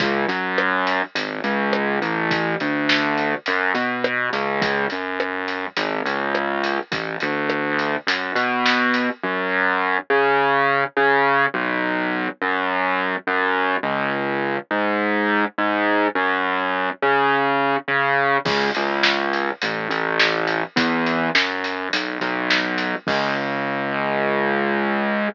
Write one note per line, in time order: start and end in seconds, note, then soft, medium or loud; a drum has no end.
0.00 0.25 C#2 medium
0.00 kick loud
0.00 closed hi-hat loud
0.28 1.02 F#2 medium
0.28 closed hi-hat medium
0.58 cross-stick loud
0.87 closed hi-hat medium
1.15 1.40 G#1 medium
1.15 closed hi-hat loud
1.44 1.99 C#2 medium
1.44 closed hi-hat medium
1.73 cross-stick loud
2.02 2.55 A1 medium
2.02 closed hi-hat medium
2.31 kick loud
2.31 closed hi-hat loud
2.60 3.34 D2 medium
2.60 closed hi-hat medium
2.89 snare loud
3.18 closed hi-hat medium
3.46 3.72 F#2 medium
3.46 closed hi-hat medium
3.74 4.29 B2 medium
3.74 closed hi-hat medium
4.04 cross-stick loud
4.33 4.86 C#2 medium
4.33 closed hi-hat medium
4.62 kick loud
4.62 closed hi-hat loud
4.90 5.66 F#2 medium
4.90 closed hi-hat medium
5.20 cross-stick loud
5.48 closed hi-hat medium
5.77 6.01 G#1 medium
5.77 closed hi-hat loud
6.05 6.79 C#2 medium
6.05 closed hi-hat medium
6.35 cross-stick loud
6.64 closed hi-hat medium
6.92 7.16 A1 medium
6.92 kick loud
6.92 closed hi-hat loud
7.20 7.96 D2 medium
7.20 closed hi-hat medium
7.50 cross-stick loud
7.79 closed hi-hat medium
8.07 8.31 F#2 medium
8.07 closed hi-hat loud
8.35 9.09 B2 medium
8.35 closed hi-hat medium
8.66 snare loud
8.94 closed hi-hat medium
9.23 9.97 F#2 medium
10.10 10.84 C#3 medium
10.97 11.46 C#3 medium
11.54 12.28 B1 loud
12.42 13.15 F#2 medium
13.27 13.76 F#2 medium
13.83 14.57 C#2 medium
14.71 15.44 G#2 medium
15.58 16.07 G#2 medium
16.15 16.89 F#2 loud
17.02 17.76 C#3 medium
17.88 18.37 C#3 medium
18.45 18.70 C#2 medium
18.45 kick loud
18.45 crash loud
18.75 19.50 C#2 medium
18.75 closed hi-hat medium
19.03 snare loud
19.33 closed hi-hat medium
19.62 19.87 A1 medium
19.62 closed hi-hat loud
19.89 20.63 A1 medium
19.89 closed hi-hat medium
20.19 snare loud
20.47 closed hi-hat medium
20.76 21.29 E2 medium
20.76 kick loud
20.76 closed hi-hat loud
21.06 closed hi-hat medium
21.35 21.88 F#2 medium
21.35 snare loud
21.64 closed hi-hat medium
21.93 22.18 B1 medium
21.93 closed hi-hat loud
22.21 22.95 B1 medium
22.21 closed hi-hat medium
22.50 snare loud
22.78 closed hi-hat medium
23.07 25.28 C#2 loud
23.07 kick loud
23.07 crash loud